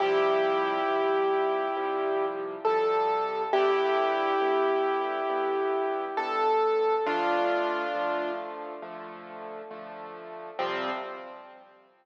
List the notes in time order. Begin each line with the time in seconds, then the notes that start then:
0.00 C3 F3 G3 E4 G4
0.88 C3 F3 G3
1.76 C3 F3 G3
2.65 C3 F3 G3 A4
3.53 G2 D3 B3 E4 G4
4.41 G2 D3 B3
5.29 G2 D3 B3
6.17 G2 D3 B3 A4
7.06 D3 F3 A3 D4 F4
7.94 D3 F3 A3
8.82 D3 F3 A3
9.71 D3 F3 A3
10.59 C3 F3 G3 C4